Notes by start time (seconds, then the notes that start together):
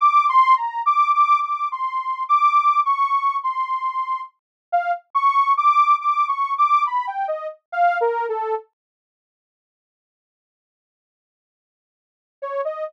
0.01 D6
0.29 C6
0.56 A#5
0.86 D6
1.14 D6
1.43 D6
1.72 C6
2.29 D6
2.85 C#6
3.43 C6
4.72 F5
5.15 C#6
5.57 D6
6.01 D6
6.28 C#6
6.58 D6
6.86 B5
7.07 G5
7.28 D#5
7.72 F5
8.01 A#4
8.29 A4
12.42 C#5
12.65 D#5